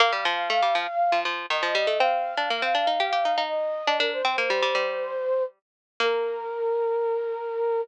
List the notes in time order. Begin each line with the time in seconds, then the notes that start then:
0.00 A#3 F5
0.12 G3
0.25 F3
0.50 A3
0.62 G3
0.75 F3
1.12 F3
1.25 F3
1.50 D#3 D#5
1.63 F3
1.75 G3
1.87 A3
1.99 C4 F5
2.37 D4
2.50 A#3
2.62 C4
2.75 D4
2.87 D#4
3.00 G4
3.13 G4
3.25 D#4
3.38 D#4
3.49 D#5
3.87 D4
3.99 D4 A#4
4.13 C5
4.25 C4
4.38 A#3
4.50 G3
4.62 G3
4.75 G3
6.00 A#3 A#4